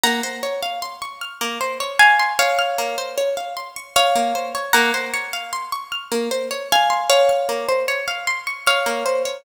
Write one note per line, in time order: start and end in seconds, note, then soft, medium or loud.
0.04 0.21 A#3 medium
0.04 1.83 F#5 loud
0.04 1.83 A#5 loud
0.23 0.41 C5 medium
0.43 0.61 C#5 medium
0.63 0.80 F5 medium
0.82 1.00 C6 medium
1.02 1.19 C#6 medium
1.21 1.39 F6 medium
1.41 1.59 A#3 medium
1.61 1.78 C5 medium
1.80 1.98 C#5 medium
1.99 2.33 F5 medium
1.99 2.33 G#5 loud
2.19 2.37 C6 medium
2.39 3.92 C#5 medium
2.39 3.92 F5 loud
2.39 2.57 C#6 medium
2.59 2.76 F6 medium
2.78 2.96 A#3 medium
2.98 3.16 C5 medium
3.18 3.35 C#5 medium
3.37 3.55 F5 medium
3.57 3.74 C6 medium
3.76 3.94 C#6 medium
3.96 4.63 C#5 medium
3.96 4.63 F5 loud
3.96 4.14 F6 medium
4.16 4.33 A#3 medium
4.35 4.53 C5 medium
4.55 4.72 C#5 medium
4.73 4.92 A#3 loud
4.73 6.52 F#5 loud
4.73 6.52 A#5 loud
4.94 5.12 C5 medium
5.14 5.31 C#5 medium
5.33 5.51 F5 medium
5.53 5.70 C6 medium
5.72 5.90 C#6 medium
5.92 6.10 F6 medium
6.12 6.29 A#3 medium
6.31 6.49 C5 medium
6.51 6.68 C#5 medium
6.72 7.09 F5 medium
6.72 7.09 G#5 loud
6.90 7.08 C6 medium
7.10 8.58 C#5 medium
7.10 8.58 F5 medium
7.10 7.27 C#6 medium
7.29 7.47 F6 medium
7.49 7.67 A#3 medium
7.69 7.86 C5 medium
7.88 8.06 C#5 medium
8.08 8.25 F5 medium
8.27 8.45 C6 medium
8.47 8.65 C#6 medium
8.67 9.38 C#5 medium
8.67 9.38 F5 medium
8.67 8.84 F6 medium
8.86 9.04 A#3 medium
9.06 9.23 C5 medium
9.25 9.43 C#5 medium